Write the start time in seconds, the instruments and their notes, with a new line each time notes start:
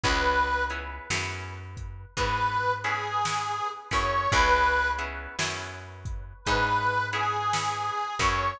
0.04 electric bass (finger) C#2, acoustic guitar (steel) B3 C#4 E4 G#4, harmonica B4, kick, closed hi-hat
0.70 acoustic guitar (steel) B3 C#4 E4 G#4, closed hi-hat
1.10 electric bass (finger) F#2, acoustic guitar (steel) B3 C#4 E4 G#4, snare
1.77 kick, closed hi-hat
2.17 electric bass (finger) G#2, acoustic guitar (steel) B3 C#4 E4 G#4, harmonica B4, kick, closed hi-hat
2.84 acoustic guitar (steel) B3 C#4 E4 G#4, harmonica G#4, closed hi-hat
3.25 acoustic guitar (steel) B3 C#4 E4 G#4, snare
3.91 electric bass (finger) F#2, acoustic guitar (steel) B3 C#4 E4 G#4, harmonica C#5, kick, closed hi-hat
4.32 electric bass (finger) C#2, acoustic guitar (steel) B3 C#4 E4 G#4, harmonica B4, kick, closed hi-hat
4.98 acoustic guitar (steel) B3 C#4 E4 G#4, closed hi-hat
5.39 electric bass (finger) F#2, acoustic guitar (steel) B3 C#4 E4 G#4, snare
6.05 kick, closed hi-hat
6.45 electric bass (finger) G#2, acoustic guitar (steel) B3 C#4 E4 G#4, harmonica B4, kick, closed hi-hat
7.13 acoustic guitar (steel) B3 C#4 E4 G#4, harmonica G#4, closed hi-hat
7.53 acoustic guitar (steel) B3 C#4 E4 G#4, snare
8.19 electric bass (finger) F#2, acoustic guitar (steel) B3 C#4 E4 G#4, harmonica C#5, kick, closed hi-hat